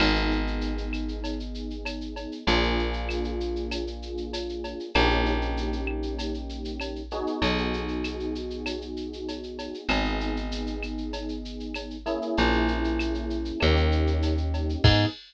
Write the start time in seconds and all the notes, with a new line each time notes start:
0.00 G#1 B3 D#4 G#4, crash, cowbell, claves
0.16 shaker
0.31 shaker
0.47 shaker
0.61 shaker
0.78 shaker
0.93 claves, shaker
1.08 shaker
1.24 cowbell, shaker
1.40 shaker
1.55 shaker
1.70 shaker
1.85 cowbell, claves, shaker
2.01 shaker
2.16 cowbell, shaker
2.32 shaker
2.47 A#1 A#3 D4 F4 G#4, cowbell, shaker
2.63 shaker
2.79 shaker
2.93 shaker
3.09 claves, shaker
3.24 shaker
3.40 shaker
3.56 shaker
3.71 cowbell, claves, shaker
3.87 shaker
4.02 shaker
4.17 shaker
4.33 cowbell, shaker
4.49 shaker
4.64 cowbell, shaker
4.80 shaker
4.94 A#1 A#3 C#4 D#4 G4, cowbell, claves, shaker
5.10 shaker
5.26 shaker
5.42 shaker
5.57 shaker
5.73 shaker
5.87 claves
6.03 shaker
6.19 cowbell, shaker
6.34 shaker
6.49 shaker
6.65 shaker
6.80 cowbell, claves, shaker
6.96 shaker
7.11 B3 D#4 F#4 G#4, cowbell, shaker
7.27 shaker
7.42 B1, cowbell, shaker
7.58 shaker
7.73 shaker
7.88 shaker
8.04 claves, shaker
8.20 shaker
8.35 shaker
8.50 shaker
8.66 cowbell, claves, shaker
8.81 shaker
8.97 shaker
9.13 shaker
9.28 cowbell, shaker
9.43 shaker
9.59 cowbell, shaker
9.74 shaker
9.89 G#1 B3 D#4 G#4, cowbell, claves, shaker
10.05 shaker
10.20 shaker
10.36 shaker
10.52 shaker
10.67 shaker
10.83 claves, shaker
10.98 shaker
11.13 cowbell, shaker
11.29 shaker
11.45 shaker
11.60 shaker
11.74 cowbell, claves, shaker
11.90 shaker
12.06 A#3 C#4 E4 G#4, cowbell, shaker
12.22 shaker
12.37 A#1, cowbell, shaker
12.53 shaker
12.68 shaker
12.84 shaker
12.99 claves, shaker
13.14 shaker
13.30 shaker
13.45 shaker
13.60 D#2 A#3 C#4 D#4 G4, cowbell, claves, shaker
13.76 shaker
13.92 shaker
14.07 shaker
14.22 cowbell, shaker
14.37 shaker
14.54 cowbell, shaker
14.69 shaker
14.84 G#2 B3 D#4 G#4, kick, crash